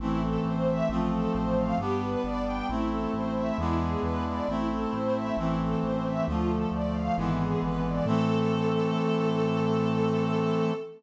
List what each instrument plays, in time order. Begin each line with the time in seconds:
0.00 synth bass 1 A1, brass section E3 A3 C4, string ensemble 1 E4
0.23 string ensemble 1 A4
0.44 synth bass 1 A1, string ensemble 1 C5
0.68 string ensemble 1 E5
0.89 synth bass 1 A1, brass section F3 A3 C4, string ensemble 1 F4
1.12 string ensemble 1 A4
1.34 synth bass 1 A1, string ensemble 1 C5
1.57 string ensemble 1 F5
1.78 synth bass 1 G1, brass section G3 B3 D4, string ensemble 1 G4
2.01 string ensemble 1 B4
2.24 synth bass 1 G1, string ensemble 1 D5
2.45 string ensemble 1 G5
2.69 synth bass 1 A1, brass section A3 C4 E4, string ensemble 1 E4
2.90 string ensemble 1 A4
3.13 synth bass 1 A1, string ensemble 1 C5
3.35 string ensemble 1 E5
3.58 synth bass 1 E2, brass section G#3 B3 D4 E4, string ensemble 1 E4
3.80 string ensemble 1 G#4
4.02 synth bass 1 E2, string ensemble 1 B4
4.26 string ensemble 1 D5
4.48 synth bass 1 A1, brass section A3 C4 E4, string ensemble 1 E4
4.70 string ensemble 1 A4
4.93 synth bass 1 A1, string ensemble 1 C5
5.14 string ensemble 1 E5
5.37 synth bass 1 A1, brass section E3 A3 C4, string ensemble 1 E4
5.60 string ensemble 1 A4
5.82 synth bass 1 A1, string ensemble 1 C5
6.04 string ensemble 1 E5
6.27 synth bass 1 D2, brass section D3 F3 A3, string ensemble 1 F4
6.49 string ensemble 1 A4
6.71 synth bass 1 D2, string ensemble 1 D5
6.94 string ensemble 1 F5
7.16 synth bass 1 G#1, brass section D3 E3 G#3 B3, string ensemble 1 E4
7.40 string ensemble 1 G#4
7.62 synth bass 1 G#1, string ensemble 1 B4
7.85 string ensemble 1 D5
8.05 synth bass 1 A2, brass section E3 A3 C4, string ensemble 1 A4